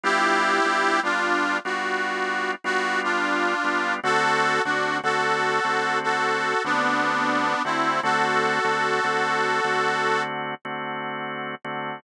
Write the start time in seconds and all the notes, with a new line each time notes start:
0.04 G3 B3 D4 E4 F4 G4
0.65 G3 B3 D4 F4
1.03 G3 B3 D4 F4
1.65 G3 B3 D4 F4 F#4
2.64 G3 B3 D4 F4 F#4
3.04 D4 F4
3.64 G3 B3 D4 F4
4.04 D3 A3 C4 F#4 A4
4.65 D3 A3 C4 D4 F#4
5.03 D3 A3 C4 F#4 A4
5.64 D3 A3 C4 F#4
6.04 F#4 A4
6.64 D3 A3 B3 C4 D4 F#4
7.65 D3 A3 C4 E4 F#4
8.03 D3 A3 C4 F#4 A4
8.64 D3 A3 C4 F#4
9.04 D3 A3 C4 F#4
9.64 D3 A3 C4 F#4
10.65 D3 A3 C4 F#4
11.64 D3 A3 C4 F#4